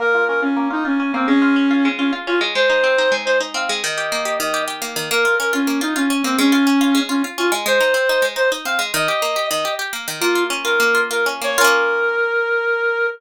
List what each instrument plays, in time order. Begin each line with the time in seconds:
0.00 orchestral harp A#3, clarinet A#4
0.15 orchestral harp F4
0.28 orchestral harp C#4, clarinet A#4
0.42 clarinet C#4, orchestral harp F4
0.57 orchestral harp A#3
0.71 clarinet D#4, orchestral harp F4
0.85 clarinet C#4, orchestral harp F4
1.00 orchestral harp C#4
1.14 orchestral harp A#3, clarinet C4
1.28 orchestral harp G#3, clarinet C#4
1.42 orchestral harp F4
1.56 orchestral harp C#4
1.71 orchestral harp F4
1.85 orchestral harp G#3
1.98 clarinet C#4, orchestral harp F4
2.13 orchestral harp F4
2.27 orchestral harp C#4, clarinet F4
2.41 orchestral harp G#3
2.55 orchestral harp G#3, clarinet C5
2.70 orchestral harp D#4
2.84 orchestral harp C4
2.98 orchestral harp D#4
3.12 orchestral harp G#3
3.25 orchestral harp D#4, clarinet C5
3.40 orchestral harp D#4
3.54 orchestral harp C4, clarinet F5
3.69 orchestral harp G#3
3.83 orchestral harp D#3, clarinet D#5
3.98 orchestral harp G4
4.12 orchestral harp A#3
4.25 orchestral harp G4
4.39 orchestral harp D#3, clarinet D#5
4.54 orchestral harp G4
4.68 orchestral harp G4
4.82 orchestral harp A#3
4.96 orchestral harp D#3
5.11 orchestral harp A#3, clarinet A#4
5.25 orchestral harp F4
5.39 orchestral harp C#4, clarinet A#4
5.53 clarinet C#4, orchestral harp F4
5.67 orchestral harp A#3
5.81 clarinet D#4, orchestral harp F4
5.96 clarinet C#4, orchestral harp F4
6.10 orchestral harp C#4
6.24 orchestral harp A#3, clarinet C4
6.38 orchestral harp G#3, clarinet C#4
6.52 orchestral harp F4
6.67 orchestral harp C#4
6.81 orchestral harp F4
6.95 orchestral harp G#3
7.09 clarinet C#4, orchestral harp F4
7.24 orchestral harp F4
7.38 orchestral harp C#4, clarinet F4
7.52 orchestral harp G#3
7.66 orchestral harp G#3, clarinet C5
7.80 orchestral harp D#4
7.94 orchestral harp C4
8.09 orchestral harp D#4
8.22 orchestral harp G#3
8.36 orchestral harp D#4, clarinet C5
8.52 orchestral harp D#4
8.65 orchestral harp C4, clarinet F5
8.79 orchestral harp G#3
8.94 orchestral harp D#3, clarinet D#5
9.08 orchestral harp G4
9.22 orchestral harp A#3
9.36 orchestral harp G4
9.49 orchestral harp D#3, clarinet D#5
9.65 orchestral harp G4
9.79 orchestral harp G4
9.93 orchestral harp A#3
10.08 orchestral harp D#3
10.21 orchestral harp A#3, clarinet F4
10.35 orchestral harp F4
10.50 orchestral harp C#4
10.64 orchestral harp F4, clarinet A#4
10.80 orchestral harp A#3
10.95 orchestral harp F4
11.11 orchestral harp F4, clarinet A#4
11.26 orchestral harp C#4
11.42 orchestral harp A#3, clarinet C#5
11.58 orchestral harp C#4 F4, clarinet A#4
11.64 orchestral harp A#3